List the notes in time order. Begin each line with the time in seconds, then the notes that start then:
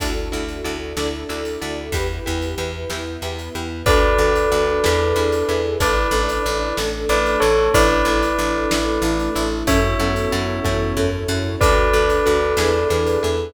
0.00 D2 D4 E4 F#4 A4, kick, closed hi-hat
0.32 D2 D4 E4 F#4 A4
0.48 closed hi-hat
0.64 D2 D4 E4 F#4 A4
0.97 D2 D4 E4 F#4 A4 D5, snare
1.29 D2 D4 E4 F#4 A4
1.45 closed hi-hat
1.61 D2 D4 E4 F#4 A4
1.92 E2 E4 G4 B4, kick, closed hi-hat
2.26 E2 E4 G4 B4
2.42 closed hi-hat
2.58 E2 E4 G4 B4
2.90 E2 B3 E4 G4 B4, snare
3.22 E2 E4 G4 B4
3.39 closed hi-hat
3.55 E2 E4 G4 B4
3.86 D2 D4 F#4 A4 B4 D5, kick, closed hi-hat
4.18 D2 D4 F#4 A4
4.35 closed hi-hat
4.52 D2 D4 F#4 A4
4.84 E2 D4 E4 G#4 B4, snare
5.16 E2 D4 E4 G#4 B4
5.32 closed hi-hat
5.47 E2 D4 E4 G#4 A4 B4
5.80 A1 D4 E4 A4 B4 D5, kick, closed hi-hat
6.11 A1 D4 E4 A4
6.29 closed hi-hat
6.46 A1 D4 E4 A4
6.77 A1 A3 D4 E4 A4, snare
7.09 A1 D4 E4 A4 B4 D5
7.26 closed hi-hat
7.40 A1 D4 E4 A4 C#5
7.73 A1 D4 E4 A4 B4 D5, kick, closed hi-hat
8.05 A1 D4 E4 A4
8.22 closed hi-hat
8.39 A1 D4 E4 A4
8.71 A1 A3 D4 E4 A4, snare
9.02 A1 D4 E4 A4
9.19 closed hi-hat
9.35 A1 D4 E4 A4
9.67 F#2 C#4 E4 F#4 A4 C#5 E5, kick, closed hi-hat
9.99 F#2 B3 C#4 E4 F#4 A4
10.16 closed hi-hat
10.32 F#2 C#4 E4 F#4 A4
10.65 F#2 B3 C#4 E4 F#4 A4 C#5, kick, high tom
10.97 F#2 C#4 E4 F#4 A4, floor tom
11.28 F#2 C#4 E4 F#4 A4
11.60 D2 D4 F#4 A4 B4 D5, kick, closed hi-hat
11.93 D2 D4 F#4 A4
12.10 closed hi-hat
12.26 D2 D4 F#4 A4
12.57 E2 D4 E4 G#4 B4, snare
12.90 E2 D4 E4 G#4 B4
13.07 closed hi-hat
13.22 E2 D4 E4 G#4 A4 B4